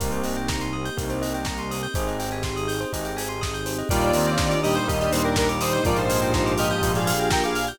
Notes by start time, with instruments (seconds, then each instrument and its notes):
0.00 synth bass 1 C2, electric piano 1 A#3 C4 D#4 G4, pad 2 (warm) A#3 C4 D#4 G4, tubular bells A#4, kick, closed hi-hat
0.12 tubular bells C5, closed hi-hat
0.23 tubular bells D#5, open hi-hat
0.37 tubular bells G5, closed hi-hat
0.48 tubular bells A#5, kick, snare
0.60 tubular bells C6, closed hi-hat
0.73 tubular bells D#6
0.85 tubular bells G6, closed hi-hat
0.97 synth bass 1 C2, electric piano 1 A#3 C4 D#4 G4, tubular bells A#4, kick, closed hi-hat
1.10 tubular bells C5, closed hi-hat
1.22 tubular bells D#5, open hi-hat
1.34 tubular bells G5, closed hi-hat
1.45 tubular bells A#5, kick, snare
1.57 tubular bells C6, closed hi-hat
1.71 tubular bells D#6, open hi-hat
1.83 tubular bells G6, closed hi-hat
1.94 synth bass 1 G#1, electric piano 1 C4 D#4 G4 G#4, pad 2 (warm) C4 D#4 G4 G#4, tubular bells C5, kick, closed hi-hat
2.08 tubular bells D#5, closed hi-hat
2.20 tubular bells G5, open hi-hat
2.31 tubular bells G#5, closed hi-hat
2.43 tubular bells C6, kick, snare
2.56 tubular bells D#6, closed hi-hat
2.68 tubular bells G6, open hi-hat
2.80 tubular bells C5, closed hi-hat
2.93 synth bass 1 G#1, electric piano 1 C4 D#4 G4 G#4, tubular bells D#5, kick, closed hi-hat
3.05 tubular bells G5, closed hi-hat
3.17 tubular bells G#5, open hi-hat
3.29 tubular bells C6, closed hi-hat
3.41 tubular bells D#6, kick, snare
3.54 tubular bells G6, closed hi-hat
3.66 tubular bells C5, open hi-hat
3.78 tubular bells D#5, closed hi-hat
3.89 synth bass 1 D#2, brass section A#2 G3, pad 2 (warm) A#3 D4 D#4 G4, electric piano 1 A#3 D4 D#4 G4, lead 1 (square) F4 D5, tubular bells A#4, kick, closed hi-hat
4.01 tubular bells D5, closed hi-hat
4.13 brass section D#3 C4, tubular bells D#5, open hi-hat
4.27 tubular bells G5, closed hi-hat
4.38 tubular bells A#5, kick, snare
4.51 tubular bells D6, closed hi-hat
4.63 brass section A#2 G3, lead 1 (square) G4 D#5, tubular bells D#6, open hi-hat
4.75 lead 1 (square) D#4 C5, tubular bells G6, closed hi-hat
4.88 synth bass 1 D#2, electric piano 1 A#3 D4 D#4 G4, lead 1 (square) G4 D#5, tubular bells A#4, kick, closed hi-hat
5.00 lead 1 (square) G4 D#5, tubular bells D5, closed hi-hat
5.12 brass section A#2 G3, lead 1 (square) D#4 C5, tubular bells D#5, open hi-hat
5.23 lead 1 (square) D4 A#4, tubular bells G5, closed hi-hat
5.36 lead 1 (square) D4 A#4, tubular bells A#5, kick, snare
5.49 tubular bells D6, closed hi-hat
5.61 lead 1 (square) D#4 C5, tubular bells D#6, open hi-hat
5.73 tubular bells G6, closed hi-hat
5.84 synth bass 1 A#1, brass section G#2 F3, pad 2 (warm) A#3 D4 F4 G4, electric piano 1 A#3 D4 F4 G4, lead 1 (square) F4 D5, tubular bells A#4, kick, closed hi-hat
5.96 lead 1 (square) D#4 C5, tubular bells D5, closed hi-hat
6.10 tubular bells F5, open hi-hat
6.22 tubular bells G5, closed hi-hat
6.34 tubular bells A#5, kick, snare
6.46 tubular bells D6, closed hi-hat
6.58 lead 1 (square) G4 D#5, tubular bells F6, open hi-hat
6.70 tubular bells G6, closed hi-hat
6.82 synth bass 1 A#1, electric piano 1 A#3 D4 F4 G4, tubular bells A#4, kick, closed hi-hat
6.95 lead 1 (square) G#4 F5, tubular bells D5, closed hi-hat
7.07 tubular bells F5, open hi-hat
7.19 tubular bells G5, closed hi-hat
7.30 lead 1 (square) A#4 G5, tubular bells A#5, kick, snare
7.44 lead 1 (square) G#4 F5, tubular bells D6, closed hi-hat
7.55 tubular bells F6, open hi-hat
7.67 tubular bells G6, closed hi-hat